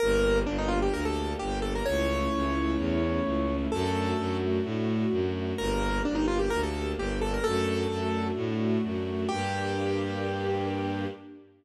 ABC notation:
X:1
M:4/4
L:1/16
Q:1/4=129
K:Gm
V:1 name="Acoustic Grand Piano"
B4 D E F G B A3 G2 A B | ^c16 | A6 z10 | B4 D E F G B A3 G2 A B |
A8 z8 | G16 |]
V:2 name="String Ensemble 1"
B,2 D2 G2 B,2 D2 G2 B,2 D2 | A,2 ^C2 =E2 A,2 C2 E2 A,2 C2 | A,2 D2 ^F2 A,2 D2 F2 A,2 D2 | B,2 D2 G2 B,2 D2 G2 B,2 D2 |
A,2 D2 ^F2 A,2 D2 F2 A,2 D2 | [B,DG]16 |]
V:3 name="Violin" clef=bass
G,,,4 G,,,4 D,,4 G,,,4 | ^C,,4 C,,4 =E,,4 C,,4 | ^F,,4 F,,4 A,,4 F,,4 | G,,,4 G,,,4 D,,4 G,,,4 |
^F,,4 F,,4 A,,4 F,,4 | G,,16 |]
V:4 name="String Ensemble 1"
[B,DG]16 | [A,^C=E]16 | [A,D^F]16 | [B,DG]16 |
[A,D^F]16 | [B,DG]16 |]